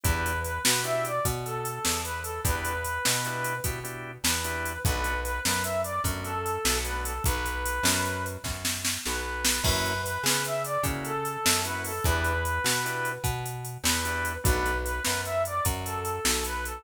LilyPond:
<<
  \new Staff \with { instrumentName = "Brass Section" } { \time 12/8 \key b \minor \tempo 4. = 100 b'4 b'8 b'8 e''8 d''8 r8 a'4. b'8 a'8 | b'2. r4. b'4. | b'4 b'8 b'8 e''8 d''8 r8 a'4. b'8 a'8 | b'2. r4. b'4. |
b'4 b'8 b'8 e''8 d''8 r8 a'4. b'8 a'8 | b'2. r4. b'4. | b'4 b'8 b'8 e''8 d''8 r8 a'4. b'8 a'8 | }
  \new Staff \with { instrumentName = "Drawbar Organ" } { \time 12/8 \key b \minor <b d' e' g'>2 <b d' e' g'>1 | <b d' e' g'>2 <b d' e' g'>4 <b d' e' g'>8 <b d' e' g'>4. <b d' e' g'>4 | <a b d' fis'>2. <a b d' fis'>2 <a b d' fis'>4 | r1. |
<ais cis' e' fis'>2. <ais cis' e' fis'>2 <ais cis' e' fis'>4 | <b d' e' g'>2 <b d' e' g'>2. <b d' e' g'>4 | <a b d' fis'>1. | }
  \new Staff \with { instrumentName = "Electric Bass (finger)" } { \clef bass \time 12/8 \key b \minor e,4. b,4. b,4. e,4. | e,4. b,4. b,4. e,4. | b,,4. fis,4. fis,4. b,,4. | b,,4. fis,4. fis,4. b,,4. |
fis,4. cis4. cis4. fis,4. | e,4. b,4. b,4. e,4. | b,,4. fis,4. fis,4. b,,4. | }
  \new DrumStaff \with { instrumentName = "Drums" } \drummode { \time 12/8 <hh bd>8 hh8 hh8 sn8 hh8 hh8 <hh bd>8 hh8 hh8 sn8 hh8 hh8 | <hh bd>8 hh8 hh8 sn8 hh8 hh8 <hh bd>8 hh4 <hh sn>8 hh8 hh8 | <hh bd>8 hh8 hh8 sn8 hh8 hh8 <hh bd>8 hh8 hh8 sn8 hh8 hh8 | <hh bd>8 hh8 hh8 sn8 hh8 hh8 <bd sn>8 sn8 sn8 sn4 sn8 |
<cymc bd>8 hh8 hh8 sn8 hh8 hh8 <hh bd>8 hh8 hh8 sn8 hh8 hho8 | <hh bd>8 hh8 hh8 sn8 hh8 hh8 <hh bd>8 hh8 hh8 sn8 hh8 hh8 | <hh bd>8 hh8 hh8 sn8 hh8 hh8 <hh bd>8 hh8 hh8 sn8 hh8 hh8 | }
>>